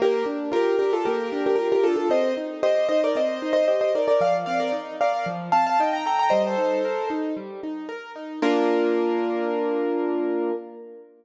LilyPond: <<
  \new Staff \with { instrumentName = "Acoustic Grand Piano" } { \time 4/4 \key bes \major \tempo 4 = 114 <g' bes'>8 r8 <g' bes'>8 <g' bes'>16 <f' a'>16 <g' bes'>8. <g' bes'>16 <g' bes'>16 <g' bes'>16 <f' a'>16 <f' a'>16 | <c'' ees''>8 r8 <c'' ees''>8 <c'' ees''>16 <bes' d''>16 <c'' ees''>8. <c'' ees''>16 <c'' ees''>16 <c'' ees''>16 <bes' d''>16 <bes' d''>16 | <d'' f''>16 r16 <d'' f''>16 <bes' d''>16 r8 <d'' f''>8 r8 <f'' a''>16 <f'' a''>16 <ees'' g''>16 <g'' bes''>16 <g'' bes''>16 <g'' bes''>16 | <c'' ees''>16 <a' c''>4~ <a' c''>16 r2 r8 |
bes'1 | }
  \new Staff \with { instrumentName = "Acoustic Grand Piano" } { \time 4/4 \key bes \major bes8 d'8 f'8 d'8 bes8 d'8 f'8 d'8 | c'8 ees'8 g'8 ees'8 c'8 ees'8 g'8 ees'8 | f8 c'8 ees'8 bes'8 f8 c'8 ees'8 a'8 | g8 ees'8 bes'8 ees'8 g8 ees'8 bes'8 ees'8 |
<bes d' f'>1 | }
>>